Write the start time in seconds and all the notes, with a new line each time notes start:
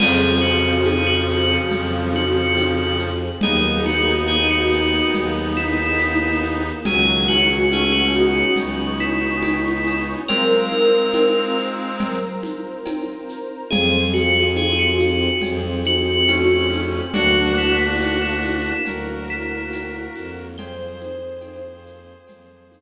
0.00 F2 C#3 F3 C4 F4 G#4, crash, cowbell, low conga, shaker
0.41 F#4, shaker
0.84 G#4, cowbell, high conga, shaker
1.07 F#4
1.28 shaker
1.71 F2, cowbell, low conga, shaker
2.13 F#4, high conga, shaker
2.57 cowbell, high conga, shaker
2.99 shaker
3.41 D#2 A#3 B3 D#4 G#4, cowbell, low conga, shaker
3.84 F#4, high conga, shaker
4.28 G#4, cowbell, high conga, shaker
4.51 F#4
4.72 shaker
5.14 D#2, cowbell, low conga, shaker
5.56 E4, high conga, shaker
5.99 cowbell, high conga, shaker
6.43 high conga, shaker
6.85 C#2 D#3 F#3 C#4 F#4 G#4 C#5 F#5 G#5, cowbell, low conga, shaker
7.28 F#4, high conga, shaker
7.71 A3 C#4 G#4, cowbell, high conga, shaker
7.93 F#4
8.13 B3 D#4, shaker
8.56 C#2 C#5 G#5 C#6, cowbell, low conga, shaker
8.99 E4, high conga, shaker
9.43 cowbell, high conga, shaker
9.87 high conga, shaker
10.28 G#3 C4 F4 A#4 C5 F5 A#5, cowbell, low conga, shaker
10.71 high conga, shaker
11.14 cowbell, high conga, shaker
11.57 shaker
11.99 A#4 C5 A#5, cowbell, low conga, shaker
12.43 high conga, shaker
12.85 cowbell, high conga, shaker
13.29 shaker
13.71 F2 C4 F4 G#4, cowbell, low conga, shaker
14.14 F#4, shaker
14.56 G#4, cowbell, high conga, shaker
14.79 F#4
14.99 high conga, shaker
15.41 F2 C4 G#4 C5, cowbell, low conga, shaker
15.85 F#4, high conga, shaker
16.28 A3 C#4, cowbell, high conga, shaker
16.71 high conga, shaker
17.14 D2 A#3 D4 F#4, cowbell, low conga, shaker
17.58 E4, shaker
17.99 F#4, cowbell, high conga, shaker
18.21 E4
18.43 high conga, shaker
18.86 D2 F#3 A#3 F#4 A#4, cowbell, low conga, shaker
19.28 E4, shaker
19.71 cowbell, high conga, shaker
20.14 F2, shaker
20.57 A#3 C4 F4 G#4 C5, cowbell, low conga, shaker
21.01 high conga, shaker
21.41 cowbell, high conga, shaker
21.86 shaker
22.27 F2 F3 A#3 F4, cowbell, low conga, shaker
22.72 high conga, shaker